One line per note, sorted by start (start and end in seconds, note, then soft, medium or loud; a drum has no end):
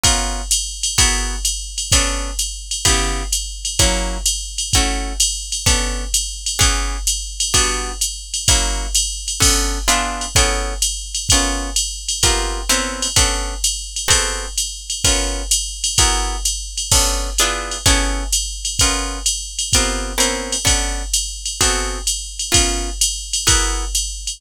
0.04 0.42 B3 medium
0.04 0.42 C#4 loud
0.04 0.42 F4 loud
0.04 0.42 A#4 loud
0.04 kick medium
0.04 ride loud
0.51 hi-hat pedal loud
0.51 ride loud
0.83 ride loud
0.98 1.36 B3 loud
0.98 1.36 E4 loud
0.98 1.36 F#4 loud
0.98 1.36 G#4 loud
0.98 1.36 A#4 loud
0.98 kick medium
0.98 ride loud
1.45 hi-hat pedal medium
1.45 ride medium
1.78 ride medium
1.92 2.31 B3 loud
1.92 2.31 C#4 loud
1.92 2.31 D4 loud
1.92 2.31 A4 loud
1.92 kick medium
1.92 ride loud
2.39 hi-hat pedal medium
2.39 ride medium
2.71 ride medium
2.85 3.23 C#3 loud
2.85 3.23 B3 loud
2.85 3.23 E4 loud
2.85 3.23 G4 loud
2.85 kick medium
2.85 ride loud
3.32 hi-hat pedal loud
3.32 ride medium
3.65 ride medium
3.79 4.18 F#3 loud
3.79 4.18 A#3 loud
3.79 4.18 C#4 loud
3.79 4.18 E4 loud
3.79 kick medium
3.79 ride loud
4.26 hi-hat pedal loud
4.26 ride loud
4.58 ride medium
4.73 5.13 A3 loud
4.73 5.13 C#4 loud
4.73 5.13 E4 medium
4.73 5.13 F#4 loud
4.73 kick medium
4.73 ride loud
5.20 hi-hat pedal medium
5.20 ride loud
5.52 ride medium
5.66 6.04 B3 loud
5.66 6.04 C#4 loud
5.66 6.04 D4 medium
5.66 6.04 A4 loud
5.66 kick medium
5.66 ride loud
6.14 hi-hat pedal loud
6.14 ride loud
6.46 ride medium
6.59 6.97 E3 loud
6.59 6.97 B3 loud
6.59 6.97 C#4 loud
6.59 6.97 G#4 loud
6.59 kick medium
6.59 ride loud
7.07 hi-hat pedal loud
7.07 ride loud
7.40 ride loud
7.54 7.92 G3 loud
7.54 7.92 B3 loud
7.54 7.92 D4 loud
7.54 7.92 F#4 loud
7.54 kick medium
7.54 ride loud
8.01 hi-hat pedal loud
8.01 ride medium
8.34 ride medium
8.48 8.87 F#3 loud
8.48 8.87 A#3 loud
8.48 8.87 C#4 medium
8.48 8.87 E4 loud
8.48 kick medium
8.48 ride loud
8.95 hi-hat pedal medium
8.95 ride loud
9.28 ride medium
9.40 9.79 B3 loud
9.40 9.79 C#4 loud
9.40 9.79 D4 medium
9.40 9.79 A4 loud
9.40 kick medium
9.40 crash loud
9.40 ride loud
9.88 10.26 B3 loud
9.88 10.26 D4 loud
9.88 10.26 E4 loud
9.88 10.26 F4 loud
9.88 10.26 G#4 loud
9.88 hi-hat pedal medium
9.88 ride loud
10.21 ride medium
10.35 10.74 B3 loud
10.35 10.74 C#4 loud
10.35 10.74 E4 loud
10.35 10.74 G#4 loud
10.35 10.74 A4 loud
10.35 kick medium
10.35 ride loud
10.82 hi-hat pedal loud
10.82 ride loud
11.15 ride medium
11.29 11.70 B3 loud
11.29 11.70 C#4 loud
11.29 11.70 F4 loud
11.29 11.70 A#4 loud
11.29 kick medium
11.29 ride loud
11.76 hi-hat pedal medium
11.76 ride loud
12.08 ride medium
12.23 12.61 B3 loud
12.23 12.61 C4 loud
12.23 12.61 F4 loud
12.23 12.61 G4 medium
12.23 12.61 A#4 loud
12.23 kick medium
12.23 ride loud
12.69 13.07 B3 loud
12.69 13.07 C4 loud
12.69 13.07 C#4 medium
12.69 13.07 E4 loud
12.69 13.07 A#4 loud
12.69 hi-hat pedal medium
12.69 ride loud
13.02 ride medium
13.16 13.54 B3 loud
13.16 13.54 C#4 loud
13.16 13.54 D4 loud
13.16 13.54 A4 medium
13.16 kick medium
13.16 ride loud
13.64 hi-hat pedal loud
13.64 ride loud
13.96 ride medium
14.08 14.46 B3 loud
14.08 14.46 C4 loud
14.08 14.46 F#4 loud
14.08 14.46 G#4 medium
14.08 14.46 A4 loud
14.08 kick medium
14.08 ride loud
14.58 hi-hat pedal medium
14.58 ride medium
14.90 ride medium
15.04 15.43 B3 medium
15.04 15.43 C#4 loud
15.04 15.43 F4 loud
15.04 15.43 A#4 loud
15.04 kick medium
15.04 ride loud
15.51 hi-hat pedal loud
15.51 ride loud
15.84 ride loud
15.98 16.37 B3 loud
15.98 16.37 E4 loud
15.98 16.37 F#4 loud
15.98 16.37 G#4 loud
15.98 16.37 A#4 loud
15.98 kick medium
15.98 ride loud
16.45 hi-hat pedal medium
16.45 ride medium
16.77 ride medium
16.92 17.30 B3 loud
16.92 17.30 C#4 loud
16.92 17.30 D4 medium
16.92 17.30 A4 loud
16.92 kick medium
16.92 crash loud
16.92 ride loud
17.38 17.78 B3 loud
17.38 17.78 D4 loud
17.38 17.78 E4 loud
17.38 17.78 F4 loud
17.38 17.78 G#4 loud
17.38 hi-hat pedal medium
17.38 ride loud
17.71 ride medium
17.86 18.24 B3 loud
17.86 18.24 C#4 loud
17.86 18.24 E4 loud
17.86 18.24 G#4 loud
17.86 18.24 A4 loud
17.86 kick medium
17.86 ride loud
18.33 hi-hat pedal loud
18.33 ride loud
18.65 ride medium
18.79 19.19 B3 loud
18.79 19.19 C#4 loud
18.79 19.19 F4 loud
18.79 19.19 A#4 loud
18.79 kick medium
18.79 ride loud
19.26 hi-hat pedal medium
19.26 ride loud
19.59 ride medium
19.73 20.13 B3 loud
19.73 20.13 C4 loud
19.73 20.13 F4 loud
19.73 20.13 G4 medium
19.73 20.13 A#4 loud
19.73 kick medium
19.73 ride loud
20.18 20.56 B3 loud
20.18 20.56 C4 loud
20.18 20.56 C#4 medium
20.18 20.56 E4 loud
20.18 20.56 A#4 loud
20.18 hi-hat pedal medium
20.18 ride loud
20.52 ride medium
20.65 21.03 B3 loud
20.65 21.03 C#4 loud
20.65 21.03 D4 loud
20.65 21.03 A4 medium
20.65 kick medium
20.65 ride loud
21.13 hi-hat pedal loud
21.13 ride loud
21.46 ride medium
21.61 21.99 B3 loud
21.61 21.99 C4 loud
21.61 21.99 F#4 loud
21.61 21.99 G#4 medium
21.61 21.99 A4 loud
21.61 kick medium
21.61 ride loud
22.07 hi-hat pedal medium
22.07 ride medium
22.39 ride medium
22.52 22.90 B3 medium
22.52 22.90 C#4 loud
22.52 22.90 F4 loud
22.52 22.90 A#4 loud
22.52 kick medium
22.52 ride loud
23.01 hi-hat pedal loud
23.01 ride loud
23.33 ride loud
23.47 23.85 B3 loud
23.47 23.85 E4 loud
23.47 23.85 F#4 loud
23.47 23.85 G#4 loud
23.47 23.85 A#4 loud
23.47 kick medium
23.47 ride loud
23.95 hi-hat pedal medium
23.95 ride medium
24.27 ride medium